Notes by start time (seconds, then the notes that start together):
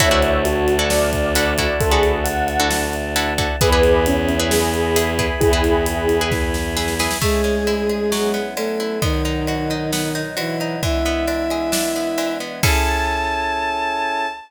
0.00 D2 D4 E4 F#4 A4 C#5 D5 E5 F#5 A5, kick, closed hi-hat
0.11 D4 E4 F#4 A4
0.22 closed hi-hat
0.45 F#4, closed hi-hat
0.68 closed hi-hat
0.79 D4 E4 F#4 A4
0.90 D5, snare
1.13 kick, closed hi-hat
1.35 D4 E4 F#4 A4, closed hi-hat
1.58 D4 E4 F#4 A4, kick, closed hi-hat
1.80 D2 A4, kick, closed hi-hat
1.91 D4 E4 F#4 G#4 A4
2.03 closed hi-hat
2.24 F#5, closed hi-hat
2.47 F#5, closed hi-hat
2.60 D4 E4 F#4 A4
2.70 snare
2.93 closed hi-hat
3.16 D4 E4 F#4 A4, closed hi-hat
3.38 D4 E4 F#4 A4, kick, closed hi-hat
3.60 E2 E4 G#4 B4 E5 G#5 B5, kick, closed hi-hat
3.72 E4 G#4 B4
3.83 closed hi-hat
4.06 C#4, closed hi-hat
4.29 closed hi-hat
4.39 E4 G#4 B4
4.50 G#4, snare
4.74 closed hi-hat
4.96 E4 G#4 B4, closed hi-hat
5.19 E4 G#4 B4, kick, closed hi-hat
5.40 E2 E4 G#4, kick, closed hi-hat
5.53 E4 G#4 B4
5.64 closed hi-hat
5.86 closed hi-hat
6.09 closed hi-hat
6.21 E4 G#4 B4
6.31 kick, snare
6.54 snare
6.77 E4 G#4 B4, snare
6.88 snare
6.99 E4 G#4 B4, snare
7.11 snare
7.21 G#3 A3 C#4 E4 G#4, kick, crash
7.44 C#4, ride
7.67 E4, ride
7.89 G#4, ride
8.12 F#3 B3 C#4 E4, snare
8.34 B3, ride
8.56 A3 C#4 A4, ride
8.80 E4, ride
9.02 B2 D#3 F#3 B3 D#4, kick, ride
9.25 D#4, ride
9.47 F#4, ride
9.70 D#4, ride
9.92 B3, snare
10.15 D#4, ride
10.37 E3 E4 F#4, ride
10.60 D#4, ride
10.83 E3 G#3 B3 D4 E4 E5, kick, ride
11.05 B3, ride
11.27 D4, ride
11.50 G#4, ride
11.72 D4, snare
11.95 B3, ride
12.18 E3, ride
12.40 B3, ride
12.63 C#4 E4 G#4 A4 A5, kick, crash